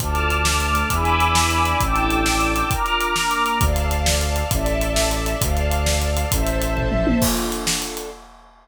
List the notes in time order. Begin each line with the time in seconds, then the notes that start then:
0.00 D2 D4 F4 A4 A5 D6 F6, kick, closed hi-hat
0.15 closed hi-hat
0.30 closed hi-hat
0.44 A3 D4 A4, snare
0.60 closed hi-hat
0.75 closed hi-hat
0.89 E2 D4 E4 G#4 B4 G#5 B5 D6 E6, kick, closed hi-hat
1.05 closed hi-hat
1.20 closed hi-hat
1.35 D4 E4 B4 D5, snare
1.51 closed hi-hat
1.65 closed hi-hat
1.80 A1 D4 E4 G4 A4 G5 A5 D6 E6, kick, closed hi-hat
1.96 closed hi-hat
2.10 closed hi-hat
2.26 D4 E4 A4 D5, snare
2.41 closed hi-hat
2.56 closed hi-hat
2.69 D4 F4 A#4 A#5 D6 F6, kick, closed hi-hat
2.86 closed hi-hat
3.01 closed hi-hat
3.16 A#3 D4 A#4, snare
3.31 closed hi-hat
3.46 closed hi-hat
3.60 D2 A4 D5 F5 A5, kick, closed hi-hat
3.76 closed hi-hat
3.91 closed hi-hat
4.06 snare
4.21 closed hi-hat
4.36 closed hi-hat
4.51 A1 A4 D5 E5 A5, kick, closed hi-hat
4.66 closed hi-hat
4.81 closed hi-hat
4.96 snare
5.11 closed hi-hat
5.26 closed hi-hat
5.40 D2 A4 D5 F5 A5, kick, closed hi-hat
5.57 closed hi-hat
5.71 closed hi-hat
5.86 snare
6.02 closed hi-hat
6.17 closed hi-hat
6.31 A1 A4 C5 E5 A5, kick, closed hi-hat
6.47 closed hi-hat
6.62 closed hi-hat
6.77 kick, floor tom
6.91 mid tom
7.07 high tom
7.21 D4 F4 A4, kick, crash
7.37 closed hi-hat
7.52 closed hi-hat
7.67 snare
7.82 closed hi-hat
7.97 closed hi-hat